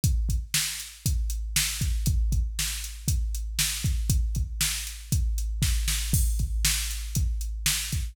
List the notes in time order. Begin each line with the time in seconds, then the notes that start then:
0.04 kick, closed hi-hat
0.29 kick, closed hi-hat
0.54 snare
0.80 closed hi-hat
1.06 kick, closed hi-hat
1.30 closed hi-hat
1.56 snare
1.81 kick, closed hi-hat
2.06 kick, closed hi-hat
2.32 kick, closed hi-hat
2.59 snare
2.84 closed hi-hat
3.08 kick, closed hi-hat
3.35 closed hi-hat
3.59 snare
3.84 kick, closed hi-hat
4.10 kick, closed hi-hat
4.35 kick, closed hi-hat
4.61 snare
4.87 closed hi-hat
5.12 kick, closed hi-hat
5.38 closed hi-hat
5.62 kick, snare
5.88 snare
6.13 kick, crash
6.39 kick, closed hi-hat
6.65 snare
6.91 closed hi-hat
7.15 kick, closed hi-hat
7.41 closed hi-hat
7.66 snare
7.92 kick, closed hi-hat